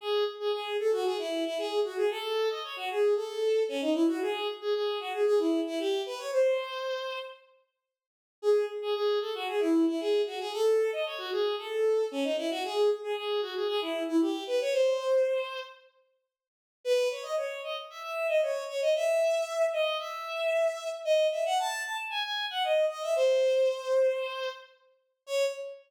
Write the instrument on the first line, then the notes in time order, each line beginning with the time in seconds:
violin
0.01 G#4
0.40 G#4
0.52 G#4
0.79 A4
0.92 F#4
1.05 G#4
1.19 E4
1.46 E4
1.58 G#4
1.85 F#4
1.97 G#4
2.11 A4
2.50 D#5
2.64 C#5
2.76 F#4
2.90 G#4
3.16 A4
3.69 C#4
3.81 D#4
3.94 E4
4.08 F#4
4.22 G#4
4.61 G#4
4.74 G#4
5.00 F#4
5.13 G#4
5.26 G#4
5.39 E4
5.66 E4
5.79 G4
6.06 B4
6.18 C#5
6.32 C5
8.42 G#4
8.82 G#4
8.94 G#4
9.21 A4
9.34 F#4
9.48 G#4
9.60 E4
9.88 E4
10.00 G#4
10.26 F#4
10.40 G#4
10.53 A4
10.92 D#5
11.06 C#5
11.18 F#4
11.32 G#4
11.58 A4
12.11 C#4
12.24 D#4
12.38 E4
12.50 F#4
12.64 G#4
13.03 G#4
13.16 G#4
13.42 F#4
13.55 G#4
13.68 G#4
13.81 E4
14.08 E4
14.21 G4
14.47 B4
14.61 C#5
14.73 C5
16.84 B4
17.11 C#5
17.23 D#5
17.37 C#5
17.64 D#5
17.90 E5
18.03 E5
18.29 D#5
18.42 C#5
18.68 C#5
18.81 D#5
18.96 E5
19.73 D#5
19.99 E5
21.05 D#5
21.32 E5
21.46 F#5
21.59 A5
21.84 A5
22.10 G#5
22.24 G#5
22.50 F#5
22.64 D#5
22.89 D#5
23.02 E5
23.16 C5
25.27 C#5